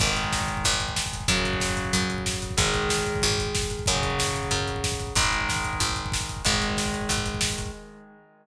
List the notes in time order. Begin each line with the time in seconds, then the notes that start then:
0.00 G#1 D#3 G#3, kick, crash
0.08 kick
0.16 kick, closed hi-hat
0.24 kick
0.32 kick, snare
0.41 kick
0.48 kick, closed hi-hat
0.57 kick
0.64 G#1, kick, closed hi-hat
0.73 kick
0.80 kick, closed hi-hat
0.88 kick
0.96 kick, snare
1.06 kick
1.13 kick, closed hi-hat
1.20 kick
1.28 F#2 C#3 F#3, kick, closed hi-hat
1.38 kick
1.45 kick, closed hi-hat
1.53 kick
1.60 kick, snare
1.70 kick
1.77 kick, closed hi-hat
1.85 kick
1.93 F#2, kick, closed hi-hat
2.01 kick
2.10 kick, closed hi-hat
2.18 kick
2.26 kick, snare
2.34 kick
2.42 kick, closed hi-hat
2.51 kick
2.57 G#1 D#3 G#3, kick, closed hi-hat
2.66 kick
2.74 kick, closed hi-hat
2.82 kick
2.89 kick, snare
2.98 kick
3.06 kick, closed hi-hat
3.15 kick
3.22 G#1, kick, closed hi-hat
3.31 kick
3.38 kick, closed hi-hat
3.46 kick
3.55 kick, snare
3.62 kick
3.70 kick, closed hi-hat
3.79 kick
3.86 F#2 C#3 F#3, kick, closed hi-hat
3.96 kick
4.03 kick, closed hi-hat
4.10 kick
4.19 kick, snare
4.28 kick
4.35 kick, closed hi-hat
4.43 kick
4.51 F#2, kick, closed hi-hat
4.60 kick
4.67 kick, closed hi-hat
4.76 kick
4.84 kick, snare
4.92 kick
5.00 kick, closed hi-hat
5.07 kick
5.15 G#1 D#3 G#3, kick, closed hi-hat
5.24 kick
5.31 kick, closed hi-hat
5.41 kick
5.49 kick, snare
5.56 kick
5.64 kick, closed hi-hat
5.73 kick
5.80 G#1, kick, closed hi-hat
5.89 kick
5.96 kick, closed hi-hat
6.06 kick
6.12 kick, snare
6.21 kick
6.29 kick, closed hi-hat
6.37 kick
6.45 G#1 D#3 G#3, kick, closed hi-hat
6.53 kick
6.60 kick, closed hi-hat
6.70 kick
6.77 kick, snare
6.86 kick
6.93 kick, closed hi-hat
7.01 kick
7.09 G#1, kick, closed hi-hat
7.18 kick
7.26 kick, closed hi-hat
7.34 kick
7.41 kick, snare
7.50 kick
7.58 kick, closed hi-hat
7.66 kick